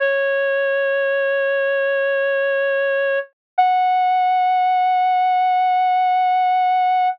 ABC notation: X:1
M:4/4
L:1/8
Q:1/4=67
K:F#m
V:1 name="Clarinet"
c8 | f8 |]